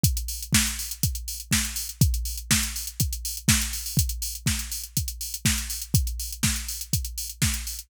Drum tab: HH |xxox-xoxxxox-xox|xxox-xoxxxox-xoo|xxox-xoxxxox-xox|xxox-xoxxxox-xox|
SD |----o-------o---|----o-------o---|----o-------o---|----o-------o---|
BD |o---o---o---o---|o---o---o---o---|o---o---o---o---|o---o---o---o---|